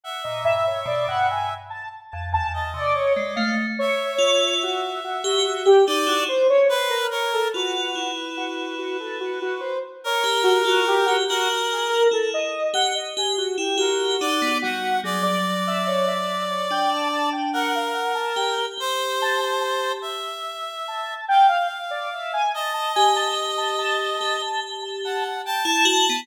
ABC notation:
X:1
M:9/8
L:1/16
Q:3/8=48
K:none
V:1 name="Lead 1 (square)"
^f ^d e ^c =d f ^g z a z a a a d c d =f z | ^c4 ^F2 F F F G z F =c ^c =c ^A ^c =A | ^F3 z F2 F A F F c z ^c z F F G F | ^F z ^G ^A =A ^d2 ^f d G F =G F4 F2 |
^G d z e ^c e2 c =g a a g ^f =f ^f a g z | z2 a a a2 z4 a2 g f z d e ^g | a a ^g a z a a a a a z a a z =g a z2 |]
V:2 name="Tubular Bells"
z ^A,, G,, z B,, G,,2 z3 F,, E,,2 C, z ^G, =A, z | z2 F2 z3 G z G ^D E z6 | F2 E8 z3 G G F z G | ^F4 E2 z G z G z E G2 ^D B, G,2 |
^F,8 D5 z3 G G | G8 z10 | z2 G6 G5 z2 E ^F B, |]
V:3 name="Clarinet"
e8 z4 ^d6 | e10 d2 z2 B2 ^A2 | B12 ^A6 | ^A4 z8 A2 d2 ^f2 |
d12 ^A6 | c6 e6 f6 | ^d10 z2 ^f2 a4 |]